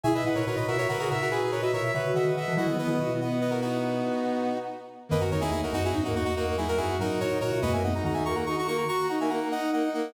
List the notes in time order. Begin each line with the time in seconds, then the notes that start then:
0.04 B2 E4 G#4 E5 G#5
0.13 B2 B4 D#5 E5
0.24 A#2 E4 B4 D#5 F#5
0.35 A#2 E4 A#4 B4 C#5
0.46 A#2 F#4 A#4 B4 C#5
0.56 A#2 B4 D#5
0.68 B2 F#4 A#4 E5
0.78 F#4 A#4 C#5
0.89 C#3 F#4 A#4 B4
0.98 C#3 F#4 G#4 A#4
1.09 A#2 F#4 A#4 E5
1.20 F#4 A#4
1.30 F#4 G#4 B4
1.42 G#4
1.51 F#4 A#4 B4 C#5
1.62 F#4 B4 D#5 E5
1.72 B2 A#4 C#5 E5
1.83 E5
1.93 C#3 F#4 B4 C#5 E5
2.14 D#3 D#5 E5 F#5
2.25 D#3 B4
2.35 D#3 D#5 E5 F#5
2.48 E3
2.56 F#3 E4 F#4 D#5 F#5
2.67 D#3 B3
2.77 B3 B4 D#5
2.87 D#3 B3 E4
3.00 B2 F#4
3.11 B3
3.20 B3 D#5 F#5
3.41 B4 D#5
3.50 F#4 A#4
3.61 D#4 F#4
5.09 F#2 D#3 A#3 B4 D#5
5.20 F#2 F#4 A#4
5.31 E2 D#3 D#4 A#4 C#5
5.41 E2 D#3 D#4 E4 G#4
5.51 E2 A#3 D#4 E4 G#4
5.61 E2 D#4 F#4 A#4
5.72 F#2 D#4 F#4
5.83 E4 F#4 G#4
5.93 G#2 D#4 F#4
6.04 G#2 F#3 A#3 D#4 F#4
6.13 E2 A#3 D#4 F#4
6.25 A#3 D#4 F#4
6.35 A#3 D#4 F#4
6.46 A#3
6.56 F#3 D#4 E4 G#4
6.68 F#3 F#4 A#4
6.77 F#2 E4 F#4 G#4
6.87 F#4
6.99 G#2 F#3 D#4 F#4 A#4
7.19 A#2 F#4 A#4 C#5
7.30 A#2 D#4
7.41 A#2 F#4 A#4 C#5
7.52 B2
7.62 D#2 F#2 A#3 F#4 B4 D#5
7.73 A#3 E5 G#5
7.83 A#3 D#4 D#5 F#5
7.94 A#3 D#4 F#5 A#5
8.04 D#3 D#4 F#4 F#5 A#5
8.14 D#4 E5 G#5
8.25 A#3 F#4 A#5 C#6
8.35 F#4 F#5 A#5
8.46 D#4 F#4 A#5 C#6
8.56 D#4 F#4 A#5 C#6
8.66 A#3 F#4 A#5 C#6
8.77 F#4 A#5 C#6
8.88 F#4 A#5 C#6
8.98 F#4
9.09 D#4 F#5 A#5
9.19 A#3 D#4 E5 G#5
9.29 A#3 F#5 A#5
9.42 A#3
9.51 D#4 D#5 F#5
9.72 A#3 D#5 F#5
9.83 D#4
9.94 A#3 D#5 F#5